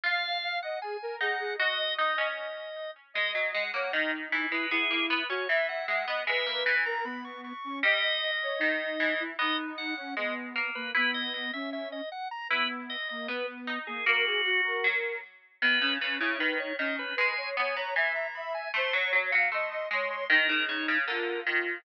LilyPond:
<<
  \new Staff \with { instrumentName = "Drawbar Organ" } { \time 2/2 \key gis \minor \tempo 2 = 77 eis''4. fis''8 gis''4 fis''4 | dis''4 dis''2~ dis''8 r8 | dis''8 r8 fis''8 fis''8 dis''8 r4 b'8 | gis'4 b'8 cis''8 e''8 fis''8 fis''4 |
e''4 gis''8 ais''8 b''8 cis'''8 cis'''4 | dis''1 | dis''8 r8 fis''8 fis''8 dis''8 r4 b'8 | b'8 dis''8 dis''8 e''8 e''8 dis''8 fis''8 ais''8 |
b'8 r8 dis''8 dis''8 b'8 r4 gis'8 | fis'2~ fis'8 r4. | b'4 b'8 cis''8 b'8 cis''8 dis''8 b'8 | gis''4 gis''8 ais''8 gis''8 ais''8 b''8 gis''8 |
bis''8 cis'''8 r4 bis''8 bis''8 bis''8 bis''8 | ais'4 cis''8 r8 ais'4 r4 | }
  \new Staff \with { instrumentName = "Ocarina" } { \time 2/2 \key gis \minor eis''4 eis''8 dis''8 gis'8 ais'8 gis'8 gis'8 | dis''2 r2 | dis''4. cis''8 dis'4. e'8 | e'4. fis'8 e''4. dis''8 |
b'4. ais'8 b4. cis'8 | dis''4. cis''8 dis'4. e'8 | dis'4. cis'8 b4. ais8 | b4. cis'4. r4 |
b4. ais8 b4. ais8 | ais'8 gis'8 fis'8 ais'4. r4 | b8 cis'8 cis'8 e'8 dis'4 cis'4 | b'8 cis''8 cis''8 cis''8 e''4 e''4 |
bis'8 cis''8 cis''8 eis''8 dis''4 cis''4 | dis'8 dis'4. eis'2 | }
  \new Staff \with { instrumentName = "Pizzicato Strings" } { \time 2/2 \key gis \minor eis'2 r4 dis'4 | fis'4 dis'8 cis'4. r4 | gis8 fis8 gis8 ais8 dis4 e8 gis8 | b8 ais8 b8 cis'8 e4 gis8 b8 |
gis8 ais8 e2~ e8 r8 | g2 dis4 e4 | b2 gis4 ais4 | e'2 r2 |
e'2 b4 dis'4 | ais2 fis4 r4 | dis8 cis8 cis8 cis8 dis4 dis4 | gis4 b8 b8 e2 |
a8 fis8 fis8 fis8 a4 gis4 | dis8 cis8 cis8 cis8 d4 dis4 | }
>>